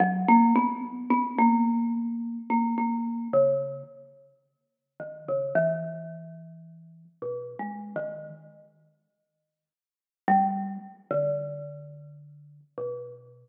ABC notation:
X:1
M:5/8
L:1/16
Q:1/4=54
K:none
V:1 name="Marimba"
_G, _B, =B, z B, _B,4 B, | _B,2 _D,2 z4 _E, D, | E,6 (3B,,2 _A,2 _E,2 | z7 G,2 z |
D,6 B,,4 |]